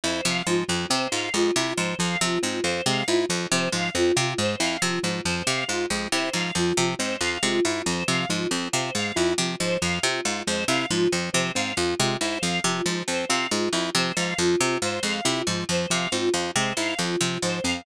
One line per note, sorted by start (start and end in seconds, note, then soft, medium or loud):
0.04 0.21 F2 medium
0.04 0.21 E4 medium
0.04 0.22 C5 medium
0.24 0.42 C3 medium
0.24 0.43 F3 medium
0.24 0.42 F5 medium
0.46 0.64 G#2 medium
0.46 0.64 F3 medium
0.46 0.66 F4 medium
0.68 0.87 F2 medium
0.68 0.86 F3 medium
0.68 0.87 F4 medium
0.90 1.08 C3 medium
0.90 1.07 C4 medium
0.90 1.08 C5 medium
1.12 1.30 G#2 medium
1.12 1.29 F4 medium
1.12 1.30 F5 medium
1.34 1.51 F2 medium
1.34 1.51 G#3 medium
1.34 1.52 F4 medium
1.56 1.73 C3 medium
1.56 1.74 E4 medium
1.56 1.74 F4 medium
1.76 1.95 G#2 medium
1.76 1.95 F3 medium
1.76 1.94 C5 medium
1.99 2.17 F2 medium
1.99 2.16 F3 medium
1.99 2.17 F5 medium
2.21 2.39 C3 medium
2.21 2.39 F3 medium
2.21 2.39 F4 medium
2.43 2.61 G#2 medium
2.43 2.60 C4 medium
2.43 2.61 F4 medium
2.63 2.81 F2 medium
2.63 2.82 F4 medium
2.63 2.80 C5 medium
2.86 3.03 C3 medium
2.86 3.04 G#3 medium
2.86 3.04 F5 medium
3.08 3.25 G#2 medium
3.08 3.26 E4 medium
3.08 3.25 F4 medium
3.29 3.47 F2 medium
3.29 3.47 F3 medium
3.29 3.48 F4 medium
3.51 3.69 C3 medium
3.51 3.69 F3 medium
3.51 3.68 C5 medium
3.72 3.90 G#2 medium
3.72 3.90 F3 medium
3.72 3.90 F5 medium
3.95 4.12 F2 medium
3.95 4.12 C4 medium
3.95 4.13 F4 medium
4.16 4.34 C3 medium
4.16 4.34 F4 medium
4.16 4.36 F4 medium
4.38 4.56 G#2 medium
4.38 4.56 G#3 medium
4.38 4.57 C5 medium
4.59 4.77 F2 medium
4.59 4.77 E4 medium
4.59 4.77 F5 medium
4.82 4.99 C3 medium
4.82 4.99 F3 medium
4.82 5.00 F4 medium
5.03 5.21 G#2 medium
5.03 5.21 F3 medium
5.03 5.22 F4 medium
5.25 5.43 F2 medium
5.25 5.43 F3 medium
5.25 5.42 C5 medium
5.47 5.64 C3 medium
5.47 5.64 C4 medium
5.47 5.64 F5 medium
5.67 5.86 G#2 medium
5.67 5.85 F4 medium
5.67 5.86 F4 medium
5.90 6.08 F2 medium
5.90 6.08 G#3 medium
5.90 6.09 F4 medium
6.12 6.30 C3 medium
6.12 6.30 E4 medium
6.12 6.30 C5 medium
6.33 6.51 G#2 medium
6.33 6.52 F3 medium
6.33 6.51 F5 medium
6.55 6.72 F2 medium
6.55 6.73 F3 medium
6.55 6.73 F4 medium
6.77 6.95 C3 medium
6.77 6.95 F3 medium
6.77 6.95 F4 medium
6.99 7.17 G#2 medium
6.99 7.16 C4 medium
6.99 7.17 C5 medium
7.21 7.38 F2 medium
7.21 7.38 F4 medium
7.21 7.39 F5 medium
7.43 7.60 C3 medium
7.43 7.60 G#3 medium
7.43 7.61 F4 medium
7.65 7.82 G#2 medium
7.65 7.82 E4 medium
7.65 7.83 F4 medium
7.86 8.04 F2 medium
7.86 8.04 F3 medium
7.86 8.04 C5 medium
8.08 8.25 C3 medium
8.08 8.25 F3 medium
8.08 8.26 F5 medium
8.29 8.47 G#2 medium
8.29 8.47 F3 medium
8.29 8.48 F4 medium
8.50 8.68 F2 medium
8.50 8.69 C4 medium
8.50 8.68 F4 medium
8.72 8.91 C3 medium
8.72 8.91 F4 medium
8.72 8.90 C5 medium
8.95 9.12 G#2 medium
8.95 9.12 G#3 medium
8.95 9.12 F5 medium
9.15 9.34 F2 medium
9.15 9.34 E4 medium
9.15 9.33 F4 medium
9.38 9.55 C3 medium
9.38 9.56 F3 medium
9.38 9.55 F4 medium
9.59 9.78 G#2 medium
9.59 9.78 F3 medium
9.59 9.77 C5 medium
9.81 9.99 F2 medium
9.81 9.99 F3 medium
9.81 9.99 F5 medium
10.03 10.21 C3 medium
10.03 10.21 C4 medium
10.03 10.20 F4 medium
10.23 10.43 G#2 medium
10.23 10.41 F4 medium
10.23 10.43 F4 medium
10.46 10.65 F2 medium
10.46 10.64 G#3 medium
10.46 10.64 C5 medium
10.68 10.86 C3 medium
10.68 10.86 E4 medium
10.68 10.86 F5 medium
10.90 11.08 G#2 medium
10.90 11.08 F3 medium
10.90 11.08 F4 medium
11.12 11.30 F2 medium
11.12 11.30 F3 medium
11.12 11.29 F4 medium
11.33 11.52 C3 medium
11.33 11.51 F3 medium
11.33 11.50 C5 medium
11.55 11.73 G#2 medium
11.55 11.73 C4 medium
11.55 11.72 F5 medium
11.76 11.94 F2 medium
11.76 11.94 F4 medium
11.76 11.95 F4 medium
11.99 12.17 C3 medium
11.99 12.17 G#3 medium
11.99 12.18 F4 medium
12.21 12.38 G#2 medium
12.21 12.39 E4 medium
12.21 12.39 C5 medium
12.41 12.60 F2 medium
12.41 12.60 F3 medium
12.41 12.58 F5 medium
12.64 12.82 C3 medium
12.64 12.81 F3 medium
12.64 12.83 F4 medium
12.86 13.03 G#2 medium
12.86 13.03 F3 medium
12.86 13.05 F4 medium
13.08 13.25 F2 medium
13.08 13.25 C4 medium
13.08 13.25 C5 medium
13.29 13.47 C3 medium
13.29 13.47 F4 medium
13.29 13.46 F5 medium
13.51 13.69 G#2 medium
13.51 13.69 G#3 medium
13.51 13.68 F4 medium
13.73 13.90 F2 medium
13.73 13.90 E4 medium
13.73 13.92 F4 medium
13.95 14.12 C3 medium
13.95 14.12 F3 medium
13.95 14.12 C5 medium
14.17 14.34 G#2 medium
14.17 14.34 F3 medium
14.17 14.34 F5 medium
14.38 14.56 F2 medium
14.38 14.56 F3 medium
14.38 14.57 F4 medium
14.59 14.78 C3 medium
14.59 14.78 C4 medium
14.59 14.76 F4 medium
14.82 14.99 G#2 medium
14.82 15.00 F4 medium
14.82 15.01 C5 medium
15.03 15.20 F2 medium
15.03 15.21 G#3 medium
15.03 15.21 F5 medium
15.25 15.43 C3 medium
15.25 15.42 E4 medium
15.25 15.43 F4 medium
15.47 15.64 G#2 medium
15.47 15.65 F3 medium
15.47 15.65 F4 medium
15.69 15.86 F2 medium
15.69 15.87 F3 medium
15.69 15.86 C5 medium
15.90 16.08 C3 medium
15.90 16.07 F3 medium
15.90 16.10 F5 medium
16.12 16.30 G#2 medium
16.12 16.30 C4 medium
16.12 16.29 F4 medium
16.34 16.51 F2 medium
16.34 16.51 F4 medium
16.55 16.73 C3 medium
16.55 16.73 G#3 medium
16.55 16.72 C5 medium
16.77 16.94 G#2 medium
16.77 16.95 E4 medium
16.77 16.97 F5 medium
16.98 17.16 F2 medium
16.98 17.16 F3 medium
16.98 17.16 F4 medium
17.21 17.38 C3 medium
17.21 17.38 F3 medium
17.21 17.38 F4 medium
17.42 17.60 G#2 medium
17.42 17.60 F3 medium
17.42 17.60 C5 medium
17.64 17.82 F2 medium
17.64 17.81 C4 medium
17.64 17.82 F5 medium